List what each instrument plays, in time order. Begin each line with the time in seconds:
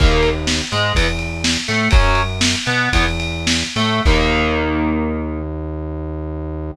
0.00 synth bass 1 D#2, overdriven guitar D#3 A#3, kick, crash
0.23 ride
0.47 snare
0.72 synth bass 1 G#2, overdriven guitar G#3, ride
0.95 synth bass 1 E2, overdriven guitar E3 B3, kick, ride
1.19 ride
1.44 snare
1.68 synth bass 1 A2, overdriven guitar A3, ride
1.91 synth bass 1 F#2, overdriven guitar F#3 C#4, kick, ride
2.15 ride
2.41 snare
2.66 synth bass 1 B2, overdriven guitar B3, ride
2.93 synth bass 1 E2, overdriven guitar E3 B3, kick, ride
3.20 ride
3.47 snare
3.76 synth bass 1 A2, overdriven guitar A3, ride
4.05 synth bass 1 D#2, overdriven guitar D#3 A#3, kick, crash